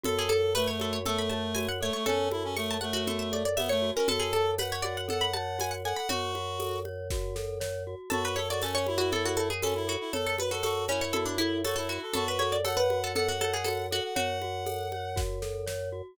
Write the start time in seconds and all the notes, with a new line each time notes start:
0.03 F#2 F#4 A4, low conga
0.18 G#4
0.29 A4, high conga
0.55 A3 B4 C#5, tambourine, high conga
0.67 C#5
0.80 F#4 A4, high conga
0.93 C#5
1.05 A3 A4, low conga
1.18 B5
1.30 C#5 A5, high conga
1.55 F#4 G#5, tambourine, high conga
1.68 F#5
1.81 A3 A4 C#5
1.93 A3 C#5
2.06 F#2 C#4 A4 C#5, low conga
2.31 E4 F#4, high conga
2.44 C#4
2.57 A3 A4 C#6, tambourine, high conga
2.71 A5
2.81 A3 C#5 F#5, high conga
2.93 F#4
3.07 F#4 A4, low conga
3.19 E5
3.32 A4 D5, high conga
3.45 D5
3.56 B3 C#5 E5, tambourine, high conga
3.69 A3 C#5
3.82 F#4
3.95 C#4 A#4
4.08 F#2 F#4 A4, low conga
4.20 G#4
4.33 A4, high conga
4.58 B4 C#5 F#5, tambourine, high conga
4.72 C#5
4.82 F#4 D5, high conga
4.97 F#5
5.08 A4 F#5, low conga
5.21 B5
5.34 C#5 A5, high conga
5.59 F#4 G#5, tambourine, high conga
5.71 F#5
5.85 A4 F#5 G#5
5.96 F#5 B5
6.09 F#2 F#4 C#5, low conga
6.35 F#4, high conga
6.60 A4, tambourine, high conga
6.85 C#5, high conga
7.10 F#4, kick, snare
7.36 A4, snare
7.60 C#5, snare
7.87 F#4
8.10 F#2 F#4 A4, low conga
8.25 B4
8.36 A4 C#5, high conga
8.49 F#4 D5
8.61 C#4 A4 C#5, tambourine, high conga
8.75 C#5
8.87 E4 F#4, high conga
8.98 F#4
9.12 A4, low conga
9.25 F#4
9.37 A4 C#5, high conga
9.50 G#4
9.62 C#4 F#4 A4, tambourine, high conga
9.75 E4
9.87 F#4 A4
10.00 E4
10.13 F#2 A4 C#5, low conga
10.26 A4
10.38 F#4 B4, high conga
10.51 F#4 A4
10.63 F#4 A4, tambourine, high conga
10.88 C#4 E4 C#5, high conga
11.01 C#5
11.13 F#4 A4, low conga
11.26 D4
11.38 E4 A4, high conga
11.64 F#4 A4 C#5, tambourine, high conga
11.76 E4 A4
11.89 F#4
12.02 A4
12.13 F#2 F#4 A4, low conga
12.28 B4
12.39 A4 C#5, high conga
12.52 D5
12.64 A4 C#5 F#5, tambourine, high conga
12.77 B4
12.90 F#4, high conga
13.04 A4
13.15 A4 F#5, low conga
13.28 F#4
13.40 A4 C#5, high conga
13.53 G#4
13.64 F#4 A4, tambourine, high conga
13.91 F#4 A4 F#5
14.04 F#5
14.15 F#2 F#4 C#5 F#5, low conga
14.42 F#4, high conga
14.66 A4, tambourine, high conga
14.92 C#5, high conga
15.16 F#4, kick, snare
15.42 A4, snare
15.66 C#5, snare
15.92 F#4